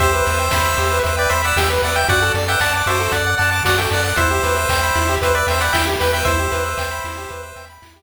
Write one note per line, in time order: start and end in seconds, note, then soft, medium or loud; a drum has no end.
0.00 0.22 E2 medium
0.00 0.12 G4 loud
0.00 0.99 C5 loud
0.00 0.99 E5 loud
0.00 kick loud
0.00 closed hi-hat loud
0.13 0.25 B4 medium
0.26 0.49 E2 medium
0.26 0.37 E5 medium
0.26 open hi-hat medium
0.39 0.51 G5 medium
0.51 0.75 E2 medium
0.51 0.64 B5 medium
0.51 kick medium
0.51 snare loud
0.65 0.77 E6 medium
0.77 1.00 E2 medium
0.77 0.90 G4 medium
0.77 open hi-hat medium
0.91 1.03 B4 medium
1.03 1.27 E2 medium
1.03 1.16 C5 medium
1.03 1.16 E5 medium
1.03 kick medium
1.03 closed hi-hat medium
1.17 1.31 B4 loud
1.17 1.31 D5 loud
1.17 1.29 G5 medium
1.29 1.53 E2 medium
1.29 1.42 C5 loud
1.29 1.42 E5 loud
1.29 1.42 B5 medium
1.29 open hi-hat medium
1.44 1.57 D5 medium
1.44 1.57 F#5 loud
1.44 1.56 E6 medium
1.56 1.78 E2 medium
1.56 1.69 G4 medium
1.56 1.69 E5 loud
1.56 1.69 G5 loud
1.56 kick medium
1.56 snare loud
1.70 1.82 B4 medium
1.82 2.05 E2 medium
1.82 1.96 D5 medium
1.82 1.95 E5 medium
1.82 1.96 F#5 medium
1.82 open hi-hat medium
1.96 2.08 E5 medium
1.96 2.08 G5 loud
1.96 2.08 G5 medium
2.08 2.31 F#2 medium
2.08 2.20 F#4 medium
2.08 2.32 D5 loud
2.08 2.32 F#5 loud
2.08 kick loud
2.08 closed hi-hat loud
2.22 2.34 A4 medium
2.34 2.57 F#2 medium
2.34 2.47 D5 medium
2.34 open hi-hat medium
2.48 2.60 E5 loud
2.48 2.60 F#5 medium
2.48 2.60 G5 loud
2.60 2.83 F#2 medium
2.60 2.73 D5 loud
2.60 2.73 F#5 loud
2.60 2.72 A5 medium
2.60 kick medium
2.60 clap loud
2.73 2.88 D5 medium
2.73 2.88 F#5 medium
2.73 2.85 D6 medium
2.86 3.08 F#2 medium
2.86 2.99 F#4 medium
2.86 3.12 C5 loud
2.86 3.12 E5 loud
2.86 open hi-hat medium
3.00 3.12 A4 medium
3.12 3.35 F#2 medium
3.12 3.35 D5 medium
3.12 3.25 D5 medium
3.12 3.35 F#5 loud
3.12 kick medium
3.12 closed hi-hat loud
3.27 3.38 F#5 medium
3.38 3.62 F#2 medium
3.38 3.50 D5 medium
3.38 3.50 F#5 loud
3.38 3.51 A5 medium
3.38 open hi-hat medium
3.51 3.63 F#5 medium
3.51 3.63 A5 medium
3.51 3.64 D6 medium
3.63 3.87 F#2 medium
3.63 3.77 F#4 medium
3.63 3.78 D5 loud
3.63 3.78 F#5 loud
3.63 kick medium
3.63 snare loud
3.78 3.91 A4 medium
3.78 3.90 E5 medium
3.78 3.90 G5 loud
3.91 4.13 F#2 medium
3.91 4.03 D5 medium
3.91 4.04 D5 medium
3.91 4.04 F#5 loud
3.91 open hi-hat medium
4.04 4.17 D5 medium
4.04 4.17 F#5 loud
4.04 4.16 F#5 medium
4.16 4.40 E2 medium
4.16 4.29 E4 loud
4.16 5.16 C5 loud
4.16 5.16 E5 loud
4.16 kick loud
4.16 closed hi-hat loud
4.31 4.42 G4 medium
4.43 4.66 E2 medium
4.43 4.55 B4 medium
4.43 open hi-hat medium
4.57 4.68 E5 medium
4.69 4.91 E2 medium
4.69 4.81 G5 medium
4.69 kick loud
4.69 clap loud
4.83 4.95 B5 medium
4.95 5.18 E2 medium
4.95 5.07 E4 medium
4.95 open hi-hat medium
5.09 5.21 G4 medium
5.21 5.43 E2 medium
5.21 5.33 B4 medium
5.21 5.35 C5 medium
5.21 5.35 E5 loud
5.21 kick medium
5.21 closed hi-hat loud
5.35 5.47 B4 medium
5.35 5.47 D5 loud
5.35 5.47 E5 medium
5.47 5.69 E2 medium
5.47 5.62 C5 medium
5.47 5.62 E5 loud
5.47 5.60 G5 medium
5.47 open hi-hat medium
5.61 5.73 D5 medium
5.61 5.73 F#5 loud
5.61 5.73 B5 medium
5.73 5.96 E2 medium
5.73 5.86 E4 medium
5.73 5.85 E5 loud
5.73 5.85 G5 loud
5.73 kick medium
5.73 snare loud
5.87 5.98 G4 medium
6.00 6.23 E2 medium
6.00 6.12 B4 medium
6.00 6.13 G5 medium
6.00 6.13 B5 medium
6.00 open hi-hat medium
6.13 6.24 E5 medium
6.13 6.26 G5 loud
6.25 6.48 E2 medium
6.25 6.38 E4 medium
6.25 7.65 C5 loud
6.25 7.65 E5 loud
6.25 kick loud
6.25 closed hi-hat medium
6.39 6.51 G4 medium
6.52 6.74 E2 medium
6.52 6.63 B4 medium
6.52 open hi-hat medium
6.66 6.77 E5 medium
6.78 7.00 E2 medium
6.78 6.90 G5 medium
6.78 kick medium
6.78 clap loud
6.91 7.03 B5 medium
7.04 7.26 E2 medium
7.04 7.16 E4 medium
7.04 open hi-hat medium
7.17 7.29 G4 medium
7.29 7.53 E2 medium
7.29 7.42 B4 medium
7.29 kick medium
7.29 closed hi-hat medium
7.43 7.55 E5 medium
7.56 7.78 E2 medium
7.56 7.68 G5 medium
7.56 open hi-hat medium
7.70 7.81 B5 medium
7.82 8.02 E2 medium
7.82 7.94 E4 medium
7.82 kick medium
7.82 clap loud
7.96 8.02 G4 medium